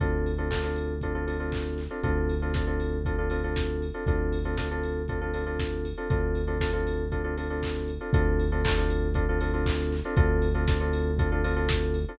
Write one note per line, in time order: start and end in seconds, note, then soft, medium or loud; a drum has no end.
0.00 1.88 D2 medium
0.00 0.31 C4 medium
0.00 0.31 D4 medium
0.00 0.31 F4 medium
0.00 0.31 A4 medium
0.00 kick medium
0.00 closed hi-hat medium
0.26 open hi-hat medium
0.38 0.48 C4 medium
0.38 0.48 D4 medium
0.38 0.48 F4 medium
0.38 0.48 A4 medium
0.51 0.61 C4 medium
0.51 0.61 D4 medium
0.51 0.61 F4 medium
0.51 0.61 A4 medium
0.51 kick medium
0.51 clap loud
0.63 0.94 C4 medium
0.63 0.94 D4 medium
0.63 0.94 F4 medium
0.63 0.94 A4 medium
0.76 open hi-hat medium
1.01 1.13 C4 medium
1.01 1.13 D4 medium
1.01 1.13 F4 medium
1.01 1.13 A4 medium
1.01 kick medium
1.01 closed hi-hat medium
1.15 1.25 C4 medium
1.15 1.25 D4 medium
1.15 1.25 F4 medium
1.15 1.25 A4 medium
1.27 1.37 C4 medium
1.27 1.37 D4 medium
1.27 1.37 F4 medium
1.27 1.37 A4 medium
1.27 open hi-hat medium
1.40 1.80 C4 medium
1.40 1.80 D4 medium
1.40 1.80 F4 medium
1.40 1.80 A4 medium
1.52 kick medium
1.52 clap medium
1.78 clap medium
1.90 2.01 C4 medium
1.90 2.01 D4 medium
1.90 2.01 F4 medium
1.90 2.01 A4 medium
2.03 3.90 D2 loud
2.03 2.34 C4 medium
2.03 2.34 D4 medium
2.03 2.34 F4 medium
2.03 2.34 A4 medium
2.03 kick loud
2.03 closed hi-hat medium
2.29 open hi-hat medium
2.42 2.52 C4 medium
2.42 2.52 D4 medium
2.42 2.52 F4 medium
2.42 2.52 A4 medium
2.54 2.65 C4 medium
2.54 2.65 D4 medium
2.54 2.65 F4 medium
2.54 2.65 A4 medium
2.54 kick medium
2.54 snare medium
2.67 2.97 C4 medium
2.67 2.97 D4 medium
2.67 2.97 F4 medium
2.67 2.97 A4 medium
2.80 open hi-hat medium
3.05 3.16 C4 medium
3.05 3.16 D4 medium
3.05 3.16 F4 medium
3.05 3.16 A4 medium
3.05 kick medium
3.05 closed hi-hat medium
3.18 3.28 C4 medium
3.18 3.28 D4 medium
3.18 3.28 F4 medium
3.18 3.28 A4 medium
3.30 3.41 C4 medium
3.30 3.41 D4 medium
3.30 3.41 F4 medium
3.30 3.41 A4 medium
3.30 open hi-hat medium
3.44 3.84 C4 medium
3.44 3.84 D4 medium
3.44 3.84 F4 medium
3.44 3.84 A4 medium
3.56 kick medium
3.56 snare loud
3.82 open hi-hat medium
3.94 4.04 C4 medium
3.94 4.04 D4 medium
3.94 4.04 F4 medium
3.94 4.04 A4 medium
4.06 5.93 D2 medium
4.06 4.38 C4 medium
4.06 4.38 D4 medium
4.06 4.38 F4 medium
4.06 4.38 A4 medium
4.06 kick loud
4.06 closed hi-hat medium
4.33 open hi-hat medium
4.45 4.55 C4 medium
4.45 4.55 D4 medium
4.45 4.55 F4 medium
4.45 4.55 A4 medium
4.57 4.68 C4 medium
4.57 4.68 D4 medium
4.57 4.68 F4 medium
4.57 4.68 A4 medium
4.57 kick medium
4.57 snare loud
4.71 5.01 C4 medium
4.71 5.01 D4 medium
4.71 5.01 F4 medium
4.71 5.01 A4 medium
4.83 open hi-hat medium
5.08 5.19 C4 medium
5.08 5.19 D4 medium
5.08 5.19 F4 medium
5.08 5.19 A4 medium
5.08 kick medium
5.08 closed hi-hat medium
5.21 5.31 C4 medium
5.21 5.31 D4 medium
5.21 5.31 F4 medium
5.21 5.31 A4 medium
5.34 5.44 C4 medium
5.34 5.44 D4 medium
5.34 5.44 F4 medium
5.34 5.44 A4 medium
5.34 open hi-hat medium
5.46 5.87 C4 medium
5.46 5.87 D4 medium
5.46 5.87 F4 medium
5.46 5.87 A4 medium
5.60 kick medium
5.60 snare loud
5.85 open hi-hat medium
5.97 6.08 C4 medium
5.97 6.08 D4 medium
5.97 6.08 F4 medium
5.97 6.08 A4 medium
6.10 7.98 D2 medium
6.10 6.41 C4 medium
6.10 6.41 D4 medium
6.10 6.41 F4 medium
6.10 6.41 A4 medium
6.10 kick loud
6.10 closed hi-hat medium
6.35 open hi-hat medium
6.47 6.58 C4 medium
6.47 6.58 D4 medium
6.47 6.58 F4 medium
6.47 6.58 A4 medium
6.60 6.71 C4 medium
6.60 6.71 D4 medium
6.60 6.71 F4 medium
6.60 6.71 A4 medium
6.60 kick medium
6.60 snare loud
6.73 7.04 C4 medium
6.73 7.04 D4 medium
6.73 7.04 F4 medium
6.73 7.04 A4 medium
6.87 open hi-hat medium
7.12 7.22 C4 medium
7.12 7.22 D4 medium
7.12 7.22 F4 medium
7.12 7.22 A4 medium
7.12 kick medium
7.12 closed hi-hat medium
7.24 7.34 C4 medium
7.24 7.34 D4 medium
7.24 7.34 F4 medium
7.24 7.34 A4 medium
7.37 7.47 C4 medium
7.37 7.47 D4 medium
7.37 7.47 F4 medium
7.37 7.47 A4 medium
7.37 open hi-hat medium
7.50 7.91 C4 medium
7.50 7.91 D4 medium
7.50 7.91 F4 medium
7.50 7.91 A4 medium
7.63 kick medium
7.63 clap loud
7.88 open hi-hat medium
8.01 8.11 C4 medium
8.01 8.11 D4 medium
8.01 8.11 F4 medium
8.01 8.11 A4 medium
8.13 10.01 D2 loud
8.13 8.44 C4 loud
8.13 8.44 D4 loud
8.13 8.44 F4 medium
8.13 8.44 A4 loud
8.13 kick loud
8.13 closed hi-hat loud
8.39 open hi-hat medium
8.52 8.62 C4 medium
8.52 8.62 D4 medium
8.52 8.62 F4 medium
8.52 8.62 A4 medium
8.64 8.75 C4 medium
8.64 8.75 D4 medium
8.64 8.75 F4 medium
8.64 8.75 A4 loud
8.64 kick loud
8.64 clap loud
8.77 9.08 C4 medium
8.77 9.08 D4 medium
8.77 9.08 F4 medium
8.77 9.08 A4 medium
8.90 open hi-hat medium
9.14 9.25 C4 medium
9.14 9.25 D4 loud
9.14 9.25 F4 medium
9.14 9.25 A4 medium
9.14 kick medium
9.14 closed hi-hat loud
9.29 9.39 C4 medium
9.29 9.39 D4 medium
9.29 9.39 F4 medium
9.29 9.39 A4 medium
9.41 9.51 C4 medium
9.41 9.51 D4 medium
9.41 9.51 F4 medium
9.41 9.51 A4 medium
9.41 open hi-hat medium
9.53 9.94 C4 medium
9.53 9.94 D4 medium
9.53 9.94 F4 medium
9.53 9.94 A4 medium
9.66 kick medium
9.66 clap loud
9.92 clap medium
10.05 10.15 C4 medium
10.05 10.15 D4 loud
10.05 10.15 F4 medium
10.05 10.15 A4 medium
10.16 12.05 D2 loud
10.16 10.47 C4 loud
10.16 10.47 D4 loud
10.16 10.47 F4 loud
10.16 10.47 A4 loud
10.16 kick loud
10.16 closed hi-hat loud
10.42 open hi-hat medium
10.54 10.65 C4 loud
10.54 10.65 D4 medium
10.54 10.65 F4 loud
10.54 10.65 A4 medium
10.68 10.78 C4 medium
10.68 10.78 D4 medium
10.68 10.78 F4 medium
10.68 10.78 A4 medium
10.68 kick loud
10.68 snare loud
10.80 11.11 C4 loud
10.80 11.11 D4 medium
10.80 11.11 F4 medium
10.80 11.11 A4 medium
10.93 open hi-hat loud
11.19 11.29 C4 medium
11.19 11.29 D4 medium
11.19 11.29 F4 medium
11.19 11.29 A4 medium
11.19 kick loud
11.19 closed hi-hat loud
11.32 11.42 C4 medium
11.32 11.42 D4 loud
11.32 11.42 F4 medium
11.32 11.42 A4 medium
11.44 11.54 C4 loud
11.44 11.54 D4 medium
11.44 11.54 F4 loud
11.44 11.54 A4 medium
11.44 open hi-hat loud
11.56 11.97 C4 medium
11.56 11.97 D4 medium
11.56 11.97 F4 medium
11.56 11.97 A4 medium
11.69 kick loud
11.69 snare loud
11.94 open hi-hat medium
12.08 12.18 C4 medium
12.08 12.18 D4 medium
12.08 12.18 F4 medium
12.08 12.18 A4 medium